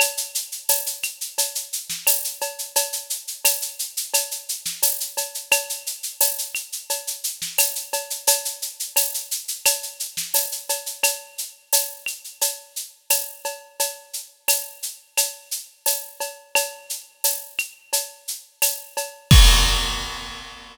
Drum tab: CC |----------------|----------------|----------------|----------------|
TB |----x-------x---|----x-------x---|----x-------x---|----x-------x---|
SH |xxxxxxxxxxxxxxxx|xxxxxxxxxxxxxxxx|xxxxxxxxxxxxxxxx|xxxxxxxxxxxxxxxx|
CB |x---x---x---x-x-|x---x---x---x-x-|x---x---x---x-x-|x---x---x---x-x-|
CL |x-----x-----x---|----x---x-------|x-----x-----x---|----x---x-------|
SD |-----------o----|-----------o----|-----------o----|-----------o----|
BD |----------------|----------------|----------------|----------------|

CC |----------------|----------------|----------------|x---------------|
TB |----x-------x---|----x-------x---|----x-------x---|----------------|
SH |x-x-x-xxx-x-x-x-|x-x-x-x-x-x-x-x-|x-x-x-x-x-x-x-x-|----------------|
CB |x---x---x---x-x-|x---x---x---x-x-|x---x---x---x-x-|----------------|
CL |x-----x-----x---|----x---x-------|x-----x-----x---|----------------|
SD |----------------|----------------|----------------|----------------|
BD |----------------|----------------|----------------|o---------------|